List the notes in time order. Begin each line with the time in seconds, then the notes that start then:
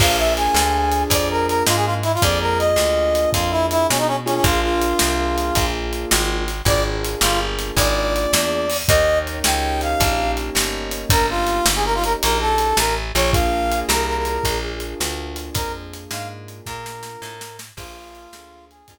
0.00 A#1 A#3 D4 F4 G#4 F5, kick, crash
0.18 E5
0.37 G#5, closed hi-hat
0.54 D2, snare
0.92 closed hi-hat
1.10 F2 D5, kick, closed hi-hat
1.30 A#4
1.48 A#4, closed hi-hat
1.67 G#2 F4, snare
1.76 G#4
1.85 F4
2.03 E4, closed hi-hat
2.14 F4, closed hi-hat
2.22 F2 A#3 D4 F4 G#4 D5, kick, closed hi-hat
2.41 A#4
2.59 D#5, closed hi-hat
2.76 D2, snare
3.15 closed hi-hat
3.33 F2 F4, kick, closed hi-hat
3.51 E4
3.71 E4, closed hi-hat
3.89 B2 C#4, snare
3.98 D#4
4.07 C#4
4.26 A#3 C#4 D4 F4 G#4, closed hi-hat
4.35 C#4
4.44 A#1 F4, kick, closed hi-hat
4.63 F4
4.82 closed hi-hat
4.99 C2, snare
5.38 closed hi-hat
5.55 A#1, kick, closed hi-hat
5.93 closed hi-hat
6.11 G#1, snare
6.48 closed hi-hat
6.65 G#1 A#3 D4 F4 G#4 D5, kick, closed hi-hat
7.04 closed hi-hat
7.21 G1 F4, snare
7.59 closed hi-hat
7.77 G#1 D5, kick, closed hi-hat
8.16 closed hi-hat
8.33 E2, snare
8.70 open hi-hat
8.88 D#2 A#3 C#4 D#4 G4 D#5, kick, closed hi-hat
9.27 closed hi-hat
9.44 C#2 G5, snare
9.81 F5, closed hi-hat
10.00 A#1, kick, closed hi-hat
10.37 closed hi-hat
10.55 G1, snare
10.91 closed hi-hat
11.10 G1 A#4, kick, closed hi-hat
11.30 F4
11.47 closed hi-hat
11.66 G1, snare
11.76 G#4
11.85 A#4
11.95 F4
12.04 A#4, closed hi-hat
12.22 A#1 A#4, closed hi-hat
12.41 A4
12.58 closed hi-hat
12.77 A1 A#4, snare
13.15 A#1 C#5, closed hi-hat
13.33 A#3 D4 F4 G#4 F5, kick, closed hi-hat
13.72 closed hi-hat
13.88 C2 A#4, snare
14.08 A#4
14.17 A#4
14.25 closed hi-hat
14.44 A#1, kick, closed hi-hat
14.80 closed hi-hat
15.00 D2, snare
15.36 closed hi-hat
15.54 F2 A#4, kick, closed hi-hat
15.94 closed hi-hat
16.11 G#2 F5, snare
16.48 closed hi-hat
16.66 A#2 A#4, kick, snare
16.86 snare
17.03 snare
17.22 A2, snare
17.41 snare
17.59 snare
17.77 A#1 A#3 D4 F4 G#4, kick, crash
18.15 closed hi-hat
18.33 D2 A#3 D4 F4 G#4, snare
18.71 G#4, closed hi-hat
18.88 F2 A#3 D4 F4 G#4, kick, closed hi-hat